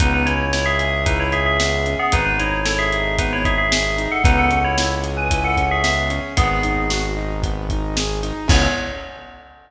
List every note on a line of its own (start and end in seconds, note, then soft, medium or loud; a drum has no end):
0.00 1.96 C#2 loud
0.00 0.25 B3 loud
0.00 0.13 D#4 medium
0.00 0.13 B4 medium
0.00 kick medium
0.00 closed hi-hat loud
0.14 0.26 D#4 medium
0.14 0.26 B4 medium
0.26 0.51 C#4 loud
0.26 0.51 E4 medium
0.26 0.51 C#5 medium
0.26 closed hi-hat medium
0.53 0.66 E4 medium
0.53 0.78 E4 medium
0.53 0.66 C#5 medium
0.53 snare medium
0.66 1.02 G#4 medium
0.66 1.02 E5 medium
0.79 1.03 G#4 loud
0.79 closed hi-hat medium
1.06 1.19 D#4 medium
1.06 1.30 E4 loud
1.06 1.19 B4 medium
1.06 kick medium
1.06 closed hi-hat medium
1.20 1.32 E4 medium
1.20 1.32 C#5 medium
1.32 1.57 C#4 medium
1.32 1.45 G#4 medium
1.32 1.45 E5 medium
1.32 closed hi-hat medium
1.46 1.92 G#4 medium
1.46 1.92 E5 medium
1.60 1.84 B3 medium
1.60 snare loud
1.86 2.11 C#4 medium
1.86 closed hi-hat medium
1.99 2.12 B3 medium
1.99 2.12 G#4 medium
2.12 4.08 G#1 medium
2.12 2.36 B3 loud
2.12 2.25 D#4 medium
2.12 2.25 B4 medium
2.12 kick medium
2.12 closed hi-hat loud
2.25 2.38 D#4 medium
2.25 2.38 B4 medium
2.39 2.64 D#4 loud
2.39 2.62 E4 medium
2.39 2.62 C#5 medium
2.39 closed hi-hat medium
2.65 2.78 E4 medium
2.65 2.89 A4 loud
2.65 2.78 C#5 medium
2.65 snare loud
2.79 3.15 G#4 medium
2.79 3.15 E5 medium
2.92 3.16 D#4 medium
2.92 closed hi-hat medium
3.18 3.42 B3 loud
3.18 3.31 D#4 medium
3.18 3.31 B4 medium
3.18 kick medium
3.18 closed hi-hat loud
3.33 3.45 E4 medium
3.33 3.45 C#5 medium
3.44 3.68 D#4 medium
3.44 3.58 G#4 medium
3.44 3.58 E5 medium
3.44 kick medium
3.44 closed hi-hat medium
3.58 4.04 G#4 medium
3.58 4.04 E5 medium
3.72 3.96 G#4 medium
3.72 snare loud
3.97 4.21 D#4 loud
3.97 closed hi-hat medium
4.12 4.24 A4 medium
4.12 4.24 F#5 medium
4.24 6.20 C#2 medium
4.24 4.48 B3 loud
4.24 4.37 D#4 medium
4.24 4.37 B4 medium
4.24 kick loud
4.24 closed hi-hat loud
4.37 4.59 A4 medium
4.37 4.59 F#5 medium
4.51 4.75 C#4 medium
4.51 closed hi-hat medium
4.64 4.86 E4 medium
4.64 4.86 C#5 medium
4.78 5.03 E4 medium
4.78 snare loud
5.04 5.28 G#4 medium
5.04 closed hi-hat medium
5.17 5.43 B4 medium
5.17 5.43 G#5 medium
5.31 5.56 E4 loud
5.31 kick medium
5.31 closed hi-hat loud
5.44 5.65 A4 medium
5.44 5.65 F#5 medium
5.57 5.82 C#4 medium
5.57 kick medium
5.57 closed hi-hat medium
5.71 5.83 G#4 medium
5.71 5.83 E5 medium
5.84 6.08 B3 medium
5.84 6.07 G#4 medium
5.84 6.07 E5 medium
5.84 snare medium
6.10 6.34 C#4 medium
6.10 closed hi-hat medium
6.37 8.32 G#1 loud
6.37 6.61 B3 loud
6.37 7.02 B3 medium
6.37 7.02 G#4 medium
6.37 kick loud
6.37 closed hi-hat loud
6.63 6.88 D#4 medium
6.63 closed hi-hat medium
6.90 7.14 F#4 medium
6.90 snare loud
7.16 7.40 D#4 medium
7.42 7.66 B3 medium
7.42 kick medium
7.42 closed hi-hat medium
7.70 7.95 D#4 medium
7.70 kick medium
7.70 closed hi-hat medium
7.97 8.21 G#4 medium
7.97 snare loud
8.23 8.47 D#4 loud
8.23 closed hi-hat medium
8.48 8.68 C#2 loud
8.48 8.66 B3 loud
8.48 8.66 C#4 loud
8.48 8.66 E4 loud
8.48 8.66 G#4 loud
8.48 8.69 C#5 loud
8.48 kick loud
8.48 crash loud